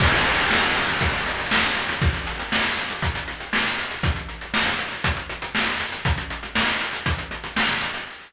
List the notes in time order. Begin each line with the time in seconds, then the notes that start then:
0.00 kick, crash
0.13 closed hi-hat
0.25 closed hi-hat
0.38 closed hi-hat
0.51 snare
0.63 closed hi-hat
0.76 closed hi-hat
0.88 closed hi-hat
1.01 kick, closed hi-hat
1.14 closed hi-hat
1.26 closed hi-hat
1.39 closed hi-hat
1.51 snare
1.64 closed hi-hat
1.76 closed hi-hat
1.89 closed hi-hat
2.02 kick, closed hi-hat
2.14 closed hi-hat
2.27 closed hi-hat
2.39 closed hi-hat
2.52 snare
2.65 closed hi-hat
2.77 closed hi-hat
2.90 closed hi-hat
3.02 kick, closed hi-hat
3.15 closed hi-hat
3.28 closed hi-hat
3.40 closed hi-hat
3.53 snare
3.66 closed hi-hat
3.78 closed hi-hat
3.91 closed hi-hat
4.03 kick, closed hi-hat
4.16 closed hi-hat
4.29 closed hi-hat
4.41 closed hi-hat
4.54 snare
4.66 closed hi-hat
4.79 closed hi-hat
4.92 closed hi-hat
5.04 kick, closed hi-hat
5.17 closed hi-hat
5.29 closed hi-hat
5.42 closed hi-hat
5.55 snare
5.67 closed hi-hat
5.80 closed hi-hat
5.92 closed hi-hat
6.05 kick, closed hi-hat
6.18 closed hi-hat
6.30 closed hi-hat
6.43 closed hi-hat
6.55 snare
6.68 closed hi-hat
6.81 closed hi-hat
6.93 closed hi-hat
7.06 kick, closed hi-hat
7.18 closed hi-hat
7.31 closed hi-hat
7.44 closed hi-hat
7.56 snare
7.69 closed hi-hat
7.82 closed hi-hat
7.94 closed hi-hat